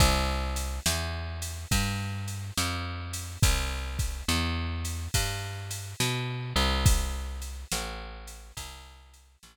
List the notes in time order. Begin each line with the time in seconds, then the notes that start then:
0.00 C2, kick, ride
0.56 ride
0.86 E2, snare
1.42 ride
1.71 G2, kick, ride
2.28 ride
2.58 F2, snare
3.13 ride
3.43 C2, kick, ride
3.99 kick, ride
4.28 E2, snare
4.85 ride
5.14 G2, kick, ride
5.71 ride
6.00 B2, snare
6.56 C2, ride
6.86 kick, ride
7.42 ride
7.72 A1, snare
8.27 ride
8.57 C2, kick, ride
9.14 ride
9.43 A1, snare